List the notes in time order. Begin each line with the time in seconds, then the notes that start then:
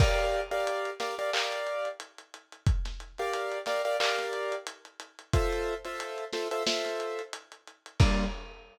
0.00 G4 A#4 D5 F5, kick, crash
0.19 closed hi-hat
0.51 G4 A#4 D5 F5, closed hi-hat
0.67 closed hi-hat
0.85 closed hi-hat
1.00 G4 A#4 D5 F5, snare, closed hi-hat
1.19 G4 A#4 D5 F5, closed hi-hat
1.33 G4 A#4 D5 F5, clap
1.52 closed hi-hat
1.67 closed hi-hat
1.85 closed hi-hat
2.00 closed hi-hat
2.18 closed hi-hat
2.34 closed hi-hat
2.52 closed hi-hat
2.67 kick, closed hi-hat
2.85 snare, closed hi-hat
3.00 closed hi-hat
3.18 G4 A#4 D5 F5, closed hi-hat
3.33 closed hi-hat
3.52 closed hi-hat
3.66 G4 A#4 D5 F5, snare, closed hi-hat
3.85 G4 A#4 D5 F5, closed hi-hat
4.00 G4 A#4 D5 F5, clap
4.18 snare, closed hi-hat
4.33 closed hi-hat
4.52 closed hi-hat
4.67 closed hi-hat
4.85 closed hi-hat
5.00 closed hi-hat
5.19 closed hi-hat
5.33 F4 A4 C5 E5, kick, closed hi-hat
5.53 closed hi-hat
5.85 F4 A4 C5 E5, closed hi-hat
6.00 closed hi-hat
6.18 closed hi-hat
6.33 F4 A4 C5 E5, snare, closed hi-hat
6.51 F4 A4 C5 E5, closed hi-hat
6.67 F4 A4 C5 E5, snare
6.85 snare, closed hi-hat
7.00 closed hi-hat
7.19 closed hi-hat
7.33 closed hi-hat
7.52 closed hi-hat
7.68 closed hi-hat
7.86 closed hi-hat
8.00 G3 A#3 D4 F4, kick, crash